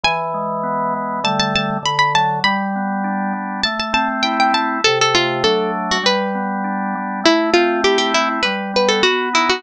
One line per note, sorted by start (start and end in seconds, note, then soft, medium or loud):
0.04 0.94 E3 loud
0.04 1.16 G#5 medium
0.34 1.19 G#3 medium
0.63 1.20 B3 medium
0.94 1.23 E3 medium
1.24 1.78 D3 loud
1.24 1.78 G3 loud
1.24 1.78 A3 loud
1.24 1.39 A5 medium
1.40 1.54 A5 medium
1.55 1.70 A5 medium
1.83 2.40 D3 loud
1.83 1.98 B5 medium
1.99 2.13 B5 medium
2.14 2.43 F#3 medium
2.14 2.39 A5 medium
2.44 3.33 G3 loud
2.44 3.59 B5 medium
2.76 3.61 B3 medium
3.04 3.61 D4 medium
3.33 3.62 G3 medium
3.63 4.52 A3 loud
3.63 3.78 A5 medium
3.79 3.93 A5 medium
3.93 4.78 C4 medium
3.93 4.08 A5 medium
4.23 4.81 E4 medium
4.23 4.37 G5 medium
4.40 4.54 G5 medium
4.53 4.81 A3 medium
4.53 4.83 A5 medium
4.84 5.43 C3 loud
4.84 4.99 A4 medium
5.01 5.16 A4 medium
5.15 5.43 A3 medium
5.15 5.43 F4 medium
5.44 5.98 F#3 loud
5.44 5.98 A3 loud
5.44 5.98 D4 loud
5.44 5.71 A4 medium
5.91 6.05 F#4 medium
6.03 6.95 G3 loud
6.03 6.82 B4 medium
6.35 7.20 B3 medium
6.64 7.21 D4 medium
6.95 7.24 G3 medium
7.24 8.14 A3 loud
7.24 7.50 E4 medium
7.54 8.40 C4 medium
7.54 7.81 F4 medium
7.84 8.42 E4 medium
7.84 7.98 G4 medium
7.98 8.12 G4 medium
8.14 8.43 A3 medium
8.14 8.29 E4 medium
8.43 9.01 G3 loud
8.43 8.71 B4 medium
8.74 9.02 B3 medium
8.74 8.90 B4 medium
8.88 9.03 A4 medium
9.03 9.60 B3 loud
9.03 9.29 F#4 medium
9.33 9.62 D#4 medium
9.33 9.49 E4 medium
9.49 9.63 F#4 medium